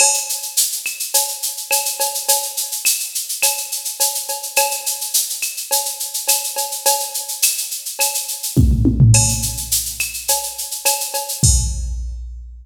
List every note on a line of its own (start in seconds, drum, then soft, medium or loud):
0.00 crash loud
0.00 cowbell loud
0.00 claves loud
0.14 shaker medium
0.29 shaker medium
0.42 shaker medium
0.57 shaker loud
0.72 shaker medium
0.86 claves loud
0.86 shaker medium
1.00 shaker medium
1.14 cowbell medium
1.14 shaker loud
1.28 shaker medium
1.43 shaker loud
1.57 shaker medium
1.71 cowbell loud
1.71 claves loud
1.71 shaker loud
1.85 shaker medium
2.00 cowbell loud
2.00 shaker loud
2.14 shaker medium
2.28 cowbell loud
2.28 shaker loud
2.43 shaker medium
2.57 shaker loud
2.72 shaker medium
2.85 claves loud
2.85 shaker loud
3.00 shaker medium
3.15 shaker medium
3.29 shaker medium
3.43 cowbell medium
3.43 claves loud
3.43 shaker loud
3.58 shaker medium
3.72 shaker medium
3.85 shaker medium
4.00 cowbell medium
4.00 shaker loud
4.15 shaker medium
4.28 cowbell medium
4.28 shaker medium
4.43 shaker medium
4.56 cowbell loud
4.56 claves loud
4.56 shaker loud
4.71 shaker medium
4.86 shaker loud
5.01 shaker medium
5.14 shaker loud
5.30 shaker medium
5.42 claves medium
5.42 shaker medium
5.57 shaker medium
5.71 cowbell loud
5.71 shaker loud
5.85 shaker medium
6.00 shaker medium
6.14 shaker medium
6.28 cowbell medium
6.28 claves loud
6.28 shaker loud
6.44 shaker medium
6.56 cowbell medium
6.56 shaker medium
6.72 shaker medium
6.86 cowbell loud
6.86 shaker loud
7.00 shaker medium
7.14 shaker medium
7.28 shaker medium
7.42 claves loud
7.42 shaker loud
7.58 shaker medium
7.71 shaker medium
7.85 shaker medium
7.99 cowbell medium
7.99 claves loud
7.99 shaker loud
8.14 shaker loud
8.28 shaker medium
8.43 shaker medium
8.57 kick loud
8.57 high tom loud
8.71 floor tom medium
8.85 high tom loud
9.00 floor tom loud
9.14 crash loud
9.14 cowbell loud
9.14 claves loud
9.29 shaker medium
9.42 shaker medium
9.57 shaker medium
9.71 shaker loud
9.85 shaker medium
10.00 claves loud
10.00 shaker medium
10.14 shaker medium
10.28 cowbell loud
10.28 shaker loud
10.43 shaker medium
10.58 shaker medium
10.71 shaker medium
10.85 cowbell loud
10.85 claves loud
10.85 shaker loud
11.00 shaker medium
11.14 cowbell loud
11.14 shaker medium
11.29 shaker medium
11.43 kick loud
11.43 crash loud